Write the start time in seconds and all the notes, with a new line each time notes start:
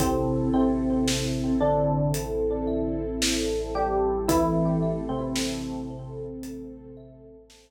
0.00 A1 C3 C4 E4 A4, kick, closed hi-hat
0.53 C3 C4 E5
1.07 A4, snare
1.60 D3 D4 C5
2.14 A4, closed hi-hat
2.67 E5
3.22 C5, snare
3.74 G3 G4 A4
4.28 E3 A3 C4 E4 A4, kick, closed hi-hat
4.82 E5
5.09 C3 C4
5.35 A4, snare
5.90 C5
6.43 A4, closed hi-hat
6.97 E5
7.50 C5, snare